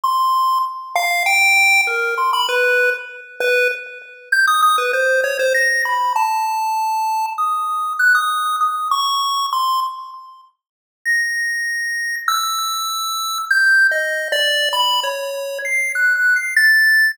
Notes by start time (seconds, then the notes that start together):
0.03 C6
0.95 F5
1.26 G5
1.87 A#4
2.18 C6
2.33 B5
2.49 B4
3.40 B4
4.32 G6
4.47 D#6
4.62 D#6
4.78 B4
4.93 C5
5.24 C#5
5.39 C5
5.54 A#6
5.85 B5
6.16 A5
7.38 D#6
7.99 F#6
8.15 D#6
8.61 D#6
8.91 C#6
9.53 C6
11.05 A#6
12.28 E6
13.51 G6
13.91 D#5
14.32 D5
14.73 B5
15.03 C#5
15.65 C7
15.95 F#6
16.16 F#6
16.36 C7
16.56 A6